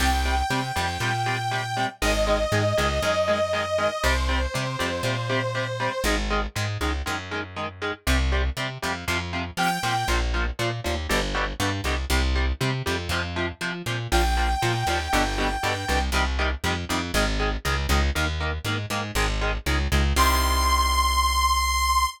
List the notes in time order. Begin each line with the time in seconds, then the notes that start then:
0.00 C2 C3 G3 G5
0.25 C3 G3
0.50 C3 G3
0.76 F2 C3 G3
1.00 A#2 C3 G3
1.26 C3 G3
1.51 C3 G3
1.76 C3 G3
2.02 G#1 D#3 G#3 D#5
2.27 D#3 G#3
2.52 G#2 D#3 G#3
2.77 C#2 D#3 G#3
3.02 F#2 D#3 G#3
3.28 D#3 G#3
3.53 D#3 G#3
3.78 D#3 G#3
4.03 C2 C3 G3 C5
4.29 C3 G3
4.54 C3 G3
4.79 F2 C3 G3
5.03 A#2 C3 G3
5.29 C3 G3
5.55 C3 G3
5.80 C3 G3
6.04 G#1 D#3 G#3
6.30 D#3 G#3
6.55 G#2 D#3 G#3
6.81 C#2 D#3 G#3
7.06 F#2 D#3 G#3
7.31 D#3 G#3
7.56 D#3 G#3
7.82 D#3 G#3
8.07 C2 C3 G3
8.32 C3 G3
8.57 C3 G3
8.82 F2 C3 G3
9.08 F2 C3 F3
9.33 C3 F3
9.57 C3 F3 G5
9.83 A#2 C3 F3
10.08 A#1 A#2 F3
10.34 A#2 F3
10.59 A#2 F3
10.84 D#2 A#2 F3
11.09 G1 B2 D3 G3
11.34 B2 D3 G3
11.60 G2 B2 D3 G3
11.84 C2 B2 D3 G3
12.10 C2 C3 G3
12.35 C3 G3
12.60 C3 G3
12.86 F2 C3 G3
13.09 F2 C3 F3
13.36 C3 F3
13.61 C3 F3
13.86 A#2 C3 F3
14.12 A#1 A#2 F3 G5
14.37 A#2 F3
14.62 A#2 F3
14.87 D#2 A#2 F3
15.13 G1 B2 D3 G3
15.38 B2 D3 G3
15.63 G2 B2 D3 G3
15.88 C2 B2 D3 G3
16.12 C2 C3 D#3 G3
16.39 C3 D#3 G3
16.64 F2 C3 D#3 G3
16.89 F2 C3 D#3 G3
17.14 G#1 D#3 G#3
17.39 D#3 G#3
17.65 C#2 D#3 G#3
17.89 C#2 D#3 G#3
18.15 D#2 D#3 A#3
18.40 D#3 A#3
18.64 G#2 D#3 A#3
18.90 G#2 D#3 A#3
19.15 G#1 D#3 G#3
19.41 D#3 G#3
19.66 C#2 D#3 G#3
19.92 C#2 D#3 G#3
20.16 C2 C3 D#3 G3 C6